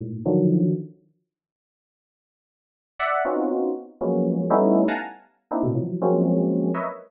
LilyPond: \new Staff { \time 2/4 \tempo 4 = 120 <gis, a, ais,>8 <d dis f fis>4 r8 | r2 | r2 | <d'' e'' fis''>8 <b c' cis' dis' f' fis'>4 r8 |
<f fis gis ais b cis'>4 <g a b cis' dis' e'>8. <f'' fis'' gis'' a'' ais''>16 | r4 <ais c' d' dis' e'>16 <a, b, c>16 <e f fis>8 | <f fis gis ais c' cis'>4. <ais' b' cis'' dis'' e''>16 r16 | }